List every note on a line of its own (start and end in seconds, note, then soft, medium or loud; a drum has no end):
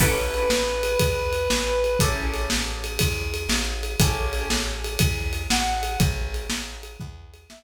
0.00 0.46 A1 medium
0.00 1.87 C#4 medium
0.00 1.87 E4 medium
0.00 1.87 G4 medium
0.00 1.87 A4 medium
0.00 1.98 B4 medium
0.00 kick medium
0.00 crash loud
0.34 ride medium
0.50 0.97 A1 medium
0.50 snare loud
0.83 ride medium
0.99 1.48 E2 medium
0.99 kick medium
0.99 ride loud
1.33 ride medium
1.50 1.97 A1 medium
1.50 snare loud
1.84 ride medium
1.99 2.47 A1 medium
1.99 3.88 C#4 medium
1.99 3.88 E4 medium
1.99 3.88 G4 medium
1.99 3.88 A4 medium
1.99 kick medium
1.99 ride loud
2.34 ride medium
2.50 2.98 A1 medium
2.50 snare loud
2.84 ride medium
2.99 3.47 E2 medium
2.99 kick medium
2.99 ride loud
3.34 ride medium
3.49 3.96 A1 medium
3.49 snare loud
3.83 ride medium
3.99 4.46 A1 medium
3.99 5.88 C#4 medium
3.99 5.88 E4 medium
3.99 5.88 G4 medium
3.99 5.88 A4 medium
3.99 kick loud
3.99 ride loud
4.33 ride medium
4.50 4.97 A1 medium
4.50 snare loud
4.84 ride medium
4.99 5.47 E2 medium
4.99 kick medium
4.99 ride loud
5.33 ride medium
5.50 5.97 A1 medium
5.50 5.98 F#5 medium
5.50 snare loud
5.83 ride medium
6.00 6.47 A1 medium
6.00 kick loud
6.00 ride loud
6.34 ride medium
6.50 6.97 A1 medium
6.50 snare loud
6.83 ride medium
7.00 7.47 E2 medium
7.00 kick medium
7.34 ride medium
7.49 7.63 A1 medium
7.49 7.63 E5 medium
7.49 snare loud